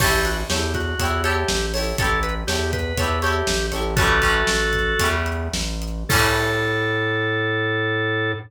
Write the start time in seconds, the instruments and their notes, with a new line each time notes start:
0.00 synth bass 1 A1, drawbar organ G4, acoustic guitar (steel) G4 A4 C#5, kick, crash
0.04 acoustic guitar (steel) E4
0.25 drawbar organ F#4, closed hi-hat
0.49 synth bass 1 E2, drawbar organ G4, acoustic guitar (steel) G4 A4 C#5, snare
0.54 acoustic guitar (steel) E4
0.74 drawbar organ F#4, kick, closed hi-hat
0.99 synth bass 1 E2, acoustic guitar (steel) G4 A4 C#5, kick, closed hi-hat
1.04 acoustic guitar (steel) E4
1.24 drawbar organ G4, acoustic guitar (steel) G4 A4 C#5, closed hi-hat
1.28 acoustic guitar (steel) E4
1.48 synth bass 1 A1, snare
1.74 acoustic guitar (steel) G4 A4 C#5, open hi-hat
1.78 acoustic guitar (steel) E4
1.98 synth bass 1 A1, acoustic guitar (steel) G4 A4 C#5, drawbar organ A4, kick, closed hi-hat
2.02 acoustic guitar (steel) E4
2.23 drawbar organ B4, closed hi-hat
2.47 synth bass 1 E2, drawbar organ G4, acoustic guitar (steel) G4 A4 C#5, snare
2.52 acoustic guitar (steel) E4
2.73 drawbar organ B4, kick, closed hi-hat
2.97 synth bass 1 E2, acoustic guitar (steel) G4 A4 C#5, kick, closed hi-hat
3.02 acoustic guitar (steel) E4
3.22 drawbar organ G4, acoustic guitar (steel) G4 A4 C#5, closed hi-hat
3.26 acoustic guitar (steel) E4
3.47 synth bass 1 A1, snare
3.72 synth bass 1 A1, acoustic guitar (steel) G4 A4 C#5, closed hi-hat
3.76 acoustic guitar (steel) E4
3.96 acoustic guitar (steel) G3 A3 C#4, drawbar organ F#4 A4, kick, closed hi-hat
4.01 acoustic guitar (steel) E3
4.22 acoustic guitar (steel) G3 A3 C#4, kick, closed hi-hat
4.26 acoustic guitar (steel) E3
4.47 synth bass 1 A1, snare
4.73 kick, closed hi-hat
4.99 synth bass 1 E2, acoustic guitar (steel) G3 A3 C#4, kick, closed hi-hat
5.04 acoustic guitar (steel) E3
5.26 closed hi-hat
5.53 synth bass 1 A1, snare
5.82 closed hi-hat
6.09 synth bass 1 A2, acoustic guitar (steel) G3 A3 C#4, drawbar organ A4, kick, crash
6.14 acoustic guitar (steel) E3